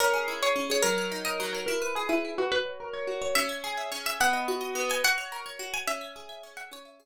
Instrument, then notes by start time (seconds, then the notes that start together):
pizzicato strings
0.00 C#4 A#4
0.14 G#4
0.28 E4
0.42 G#4 C#5
0.56 C#4
0.70 G#4 C#5
0.83 F#3 A#4
0.98 A#4
1.12 D#4
1.25 A#4 D#5
1.40 F#3
1.53 A#4 C#5
1.66 E4 A#4
1.82 B4
1.95 G#4
2.09 E4 B4
2.25 E4
2.38 F#4 B4
2.52 F#4 B4
2.65 C#5
2.80 A#4
2.93 C#5
3.07 F#4
3.22 C#5
3.35 C#4 E5
3.49 E5
3.64 G#4
3.77 E5
3.92 C#4
4.06 E5
4.20 B3 F#5
4.33 D#5
4.48 F#4
4.61 D#5
4.75 B3
4.90 D#5 G#5
5.04 F#4 F#5
5.18 C#5
5.32 A#4
5.46 C#5
5.59 F#4
5.74 C#5 G#5
5.87 C#4 E5
6.01 E5
6.16 G#4
6.29 E5
6.43 C#4
6.57 E5 F#5
6.72 C#4 C#5
6.85 E5
7.00 G#4